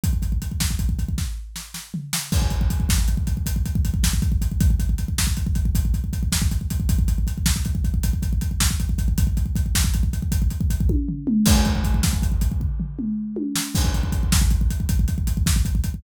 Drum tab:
CC |------------------------|x-----------------------|------------------------|------------------------|
HH |x-x-x---x-x-------------|--x-x---x-x-x-x-x---x-x-|x-x-x---x-x-x-x-x---x-x-|x-x-x---x-x-x-x-x---x-x-|
SD |------o-----o---o-o---o-|------o-----------o-----|------o-----------o-----|------o-----------o-----|
T1 |------------------------|------------------------|------------------------|------------------------|
T2 |------------------------|------------------------|------------------------|------------------------|
FT |--------------------o---|------------------------|------------------------|------------------------|
BD |ooooooooooooo-----------|oooooooooooooooooooooooo|oooooooooooooooooooooooo|oooooooooooooooooooooooo|

CC |------------------------|x-----------------------|x-----------------------|
HH |x-x-x---x-x-x-x-x-------|--x-x---x-x-------------|--x-x---x-x-x-x-x---x-x-|
SD |------o-----------------|------o---------------o-|------o-----------o-----|
T1 |------------------o-----|--------------------o---|------------------------|
T2 |----------------------o-|----------------o-------|------------------------|
FT |--------------------o---|------------o-o---------|------------------------|
BD |ooooooooooooooooooo-----|ooooooooooooo-----------|oooooooooooooooooooooooo|